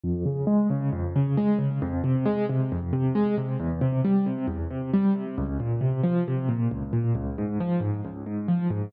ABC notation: X:1
M:4/4
L:1/8
Q:1/4=135
K:Fm
V:1 name="Acoustic Grand Piano" clef=bass
F,, D, A, D, F,, D, A, D, | F,, C, A, C, F,, C, A, C, | =E,, C, G, C, E,, C, G, C, | D,, B,, C, F, C, B,, D,, B,, |
D,, A,, F, A,, D,, A,, F, A,, |]